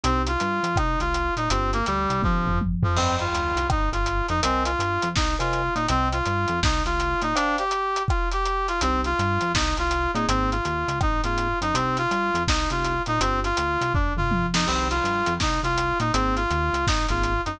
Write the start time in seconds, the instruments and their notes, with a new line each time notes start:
0.04 synth bass 1 C2, brass section C4, vibraphone C4 D#4 G4, closed hi-hat
0.27 brass section F4, closed hi-hat
0.40 synth bass 1 G2, closed hi-hat
0.63 synth bass 1 F2, closed hi-hat
0.76 synth bass 1 C2, brass section D#4, kick, cross-stick
1.00 synth bass 1 C2, brass section F4, closed hi-hat
1.14 closed hi-hat
1.37 synth bass 1 A#2, brass section D#4, closed hi-hat
1.50 synth bass 1 G1, brass section C4, vibraphone C4 D4 F4 G4, closed hi-hat
1.73 brass section A#3, closed hi-hat
1.86 synth bass 1 D2, brass section G3, closed hi-hat
2.10 synth bass 1 C2, closed hi-hat
2.22 synth bass 1 G1, brass section F3, vibraphone C4 D4 F4 G4, kick, high tom
2.46 synth bass 1 G1, floor tom
2.61 high tom
2.83 synth bass 1 F2, brass section F3, floor tom
2.96 synth bass 1 G1, brass section C4, vibraphone C5 D#5 G5, crash
3.19 brass section F4, closed hi-hat
3.33 synth bass 1 D2, closed hi-hat
3.56 synth bass 1 C2, closed hi-hat
3.70 synth bass 1 G1, brass section D#4, kick, cross-stick
3.92 synth bass 1 G1, brass section F4, closed hi-hat
4.06 closed hi-hat
4.28 synth bass 1 F2, brass section D#4, closed hi-hat
4.43 synth bass 1 C2, brass section C4, vibraphone A#4 C5 D#5 G#5, closed hi-hat
4.65 brass section F4, closed hi-hat
4.79 synth bass 1 G2, closed hi-hat
5.02 synth bass 1 F2, closed hi-hat
5.16 synth bass 1 C2, brass section D#4, kick, snare
5.39 synth bass 1 C2, brass section F4, vibraphone A#4 C5 D#5 G#5, closed hi-hat
5.53 closed hi-hat
5.75 synth bass 1 A#2, brass section D#4, closed hi-hat
5.88 synth bass 1 C2, brass section C4, vibraphone C5 D#5 G5, closed hi-hat
6.12 brass section F4, closed hi-hat
6.26 synth bass 1 G2, closed hi-hat
6.48 synth bass 1 F2, closed hi-hat
6.63 synth bass 1 C2, brass section D#4, kick, snare
6.85 synth bass 1 C2, brass section F4, closed hi-hat
7.00 closed hi-hat
7.21 synth bass 1 A#2, brass section D#4, closed hi-hat
7.35 brass section D4, vibraphone C5 D5 F5 G5, closed hi-hat
7.58 brass section G4, closed hi-hat
7.71 closed hi-hat
7.96 closed hi-hat
8.08 brass section F4, kick, cross-stick
8.31 brass section G4, closed hi-hat
8.45 closed hi-hat
8.68 brass section F4, closed hi-hat
8.81 synth bass 1 C2, brass section C4, vibraphone C4 D#4 G4, closed hi-hat
9.04 brass section F4, closed hi-hat
9.19 synth bass 1 G2, closed hi-hat
9.41 synth bass 1 F2, closed hi-hat
9.54 synth bass 1 C2, brass section D#4, kick, snare
9.77 synth bass 1 C2, brass section F4, closed hi-hat
9.91 closed hi-hat
10.14 synth bass 1 A#2, vibraphone A#3 C4 D#4 G#4, brass section D#4, closed hi-hat
10.28 synth bass 1 G#1, brass section C4, closed hi-hat
10.51 brass section F4, closed hi-hat
10.65 synth bass 1 D#2, closed hi-hat
10.88 synth bass 1 C#2, closed hi-hat
11.01 synth bass 1 G#1, brass section D#4, kick, cross-stick
11.24 synth bass 1 G#1, vibraphone A#3 C4 D#4 G#4, brass section F4, closed hi-hat
11.38 closed hi-hat
11.61 synth bass 1 F#2, brass section D#4, closed hi-hat
11.74 synth bass 1 C2, vibraphone C4 D#4 G4, brass section C4, closed hi-hat
11.97 brass section F4, closed hi-hat
12.11 synth bass 1 G2, closed hi-hat
12.34 synth bass 1 F2, closed hi-hat
12.47 synth bass 1 C2, brass section D#4, kick, snare
12.70 synth bass 1 C2, vibraphone C4 D#4 G4, brass section F4, closed hi-hat
12.84 closed hi-hat
13.06 synth bass 1 A#2, brass section D#4, closed hi-hat
13.20 synth bass 1 G1, vibraphone C4 D4 F4 G4, brass section C4, closed hi-hat
13.44 brass section F4, closed hi-hat
13.57 synth bass 1 D2, closed hi-hat
13.81 synth bass 1 C2, closed hi-hat
13.94 synth bass 1 G1, brass section D4, kick, floor tom
14.16 synth bass 1 G1, brass section F4, mid tom
14.31 high tom
14.54 synth bass 1 F2, brass section D#4, snare
14.67 synth bass 1 C2, vibraphone C4 D#4 G4, brass section C4, crash
14.90 brass section F4, closed hi-hat
15.04 synth bass 1 G2, closed hi-hat
15.26 synth bass 1 F2, closed hi-hat
15.40 synth bass 1 C2, brass section D#4, kick, snare
15.63 synth bass 1 C2, brass section F4, closed hi-hat
15.78 closed hi-hat
16.00 synth bass 1 A#2, brass section D#4, closed hi-hat
16.13 synth bass 1 G#1, vibraphone A#3 C4 D#4 G#4, brass section C4, closed hi-hat
16.36 brass section F4, closed hi-hat
16.50 synth bass 1 D#2, closed hi-hat
16.73 synth bass 1 C#2, closed hi-hat
16.87 synth bass 1 G#1, brass section D#4, kick, snare
17.09 synth bass 1 G#1, vibraphone A#3 C4 D#4 G#4, brass section F4, closed hi-hat
17.23 closed hi-hat
17.45 synth bass 1 F#2, brass section D#4, closed hi-hat